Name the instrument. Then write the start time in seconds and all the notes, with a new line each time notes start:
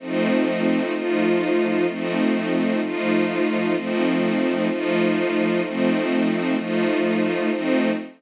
string ensemble 1
0.00 F3 A3 C4 D#4
0.94 F3 A3 D#4 F4
1.88 F3 A3 C4 D#4
2.81 F3 A3 D#4 F4
3.75 F3 A3 C4 D#4
4.69 F3 A3 D#4 F4
5.62 F3 A3 C4 D#4
6.56 F3 A3 D#4 F4
7.50 F3 A3 C4 D#4